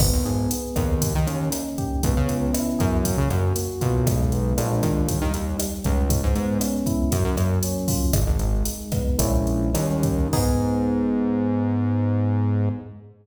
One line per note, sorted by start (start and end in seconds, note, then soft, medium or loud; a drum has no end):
0.00 0.11 G#1 loud
0.00 0.51 B3 medium
0.00 kick loud
0.00 cross-stick loud
0.00 crash loud
0.13 0.24 D#2 medium
0.25 0.48 G#1 medium
0.25 0.98 G#4 medium
0.25 closed hi-hat medium
0.51 1.00 B3 medium
0.51 closed hi-hat loud
0.76 1.14 D#2 loud
0.76 1.98 A#3 medium
0.76 kick medium
0.76 cross-stick loud
0.76 closed hi-hat medium
1.02 kick loud
1.02 closed hi-hat loud
1.15 1.27 D#3 medium
1.27 1.50 D#2 loud
1.27 2.00 C#4 medium
1.27 closed hi-hat medium
1.52 2.00 D#4 medium
1.52 cross-stick loud
1.52 closed hi-hat loud
1.78 2.02 G4 medium
1.78 kick medium
1.78 closed hi-hat medium
2.03 2.15 C#2 loud
2.03 3.00 B3 medium
2.03 kick loud
2.03 closed hi-hat loud
2.17 2.28 C#3 loud
2.28 2.52 C#2 medium
2.28 3.01 C#4 medium
2.28 closed hi-hat medium
2.53 3.02 E4 medium
2.53 cross-stick loud
2.53 closed hi-hat loud
2.79 3.17 F#2 loud
2.79 3.03 G#4 medium
2.79 kick loud
2.79 closed hi-hat medium
3.05 3.55 A#3 medium
3.05 kick medium
3.05 closed hi-hat loud
3.18 3.29 C#3 loud
3.30 3.53 F#2 loud
3.30 4.04 F#4 medium
3.30 cross-stick loud
3.30 closed hi-hat medium
3.56 4.04 A#3 medium
3.56 closed hi-hat loud
3.81 4.54 B1 loud
3.81 4.05 F4 medium
3.81 kick medium
3.81 closed hi-hat medium
4.06 4.54 G#3 medium
4.06 kick loud
4.06 cross-stick loud
4.06 closed hi-hat loud
4.32 4.57 B3 medium
4.32 closed hi-hat medium
4.58 4.82 A#1 loud
4.58 5.03 G#3 medium
4.58 5.03 A#3 medium
4.58 5.03 D4 medium
4.58 5.03 F4 medium
4.58 closed hi-hat loud
4.83 5.20 D#2 loud
4.83 kick medium
4.83 cross-stick loud
4.83 closed hi-hat medium
5.08 5.58 G3 medium
5.08 kick loud
5.08 closed hi-hat loud
5.22 5.33 D#3 medium
5.34 5.57 D#2 medium
5.34 6.07 D#4 medium
5.34 closed hi-hat medium
5.59 6.07 G3 medium
5.59 cross-stick loud
5.59 closed hi-hat loud
5.84 6.22 C#2 loud
5.84 6.09 C#4 medium
5.84 kick medium
5.84 closed hi-hat medium
6.10 7.07 G#3 medium
6.10 kick loud
6.10 closed hi-hat loud
6.23 6.35 G#2 loud
6.35 6.58 G#2 loud
6.35 7.08 B3 medium
6.35 closed hi-hat medium
6.60 7.08 C#4 medium
6.60 cross-stick loud
6.60 closed hi-hat loud
6.86 7.10 E4 medium
6.86 kick medium
6.86 closed hi-hat medium
7.11 7.24 F#2 loud
7.11 8.08 F#3 medium
7.11 kick medium
7.11 closed hi-hat loud
7.24 7.36 F#2 loud
7.37 7.60 F#2 loud
7.37 8.09 A#3 medium
7.37 cross-stick medium
7.37 closed hi-hat medium
7.63 8.12 C#4 medium
7.63 closed hi-hat loud
7.88 8.12 F4 medium
7.88 kick loud
7.88 open hi-hat loud
8.13 8.25 G#1 loud
8.13 8.64 G#3 medium
8.13 kick loud
8.13 cross-stick loud
8.13 closed hi-hat loud
8.27 8.39 G#1 loud
8.39 8.63 G#1 medium
8.39 9.16 D#4 medium
8.39 closed hi-hat medium
8.65 9.16 G#3 medium
8.65 closed hi-hat loud
8.92 9.18 B3 medium
8.92 kick loud
8.92 cross-stick loud
8.92 closed hi-hat medium
9.19 9.71 A#1 loud
9.19 9.69 G#3 medium
9.19 9.69 A#3 medium
9.19 9.69 C#4 medium
9.19 9.69 E4 medium
9.19 kick loud
9.19 closed hi-hat loud
9.47 closed hi-hat medium
9.74 10.28 D#2 loud
9.74 10.26 G3 medium
9.74 10.26 A#3 medium
9.74 10.26 C#4 medium
9.74 10.26 D#4 medium
9.74 cross-stick medium
9.74 closed hi-hat loud
10.03 kick loud
10.03 closed hi-hat medium
10.33 12.69 G#2 medium
10.33 12.69 B3 loud
10.33 12.69 D#4 loud
10.33 12.69 G#4 loud
10.33 kick loud
10.33 crash loud